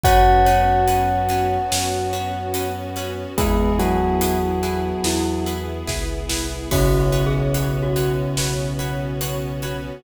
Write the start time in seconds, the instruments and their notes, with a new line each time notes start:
0.03 synth bass 2 F#2, string ensemble 1 B3 C#4 F#4, orchestral harp C#4 F#4 B4, tubular bells F#4 F#5, glockenspiel C#5, kick, closed hi-hat
0.45 orchestral harp C#4 F#4 B4, glockenspiel C#5, closed hi-hat
0.87 orchestral harp C#4 F#4 B4, closed hi-hat
1.29 orchestral harp C#4 F#4 B4, closed hi-hat
1.72 synth bass 2 F#2, orchestral harp C#4 F#4 B4, snare
2.13 orchestral harp C#4 F#4 B4, closed hi-hat
2.54 orchestral harp C#4 F#4 B4, closed hi-hat
2.96 orchestral harp C#4 F#4 B4, closed hi-hat
3.38 synth bass 2 E2, tubular bells G#3 G#4, string ensemble 1 B3 E4 G#4, glockenspiel B3, orchestral harp E4 G#4 B4, kick, closed hi-hat
3.79 tubular bells F#3 F#4, orchestral harp E4 G#4 B4, closed hi-hat
4.21 orchestral harp E4 G#4 B4, closed hi-hat
4.63 orchestral harp E4 G#4 B4, closed hi-hat
5.03 synth bass 2 E2, orchestral harp E4 G#4 B4, glockenspiel E4, snare
5.46 orchestral harp E4 G#4 B4, closed hi-hat
5.87 synth bass 2 C#2, orchestral harp E4 G#4 B4, kick, snare
6.30 synth bass 2 C2, orchestral harp E4 G#4 B4, snare
6.71 synth bass 2 B1, tubular bells C#3 C#4, string ensemble 1 B3 C#4 F#4, orchestral harp F#4 B4 C#5, glockenspiel F#4, kick, crash
7.12 orchestral harp F#4 B4 C#5, closed hi-hat
7.26 glockenspiel G#4
7.54 orchestral harp F#4 B4 C#5, closed hi-hat
7.83 glockenspiel F#4
7.96 orchestral harp F#4 B4 C#5, closed hi-hat
8.36 synth bass 2 B1, orchestral harp F#4 B4 C#5, snare
8.79 orchestral harp F#4 B4 C#5, closed hi-hat
9.21 orchestral harp F#4 B4 C#5, closed hi-hat
9.62 orchestral harp F#4 B4 C#5, closed hi-hat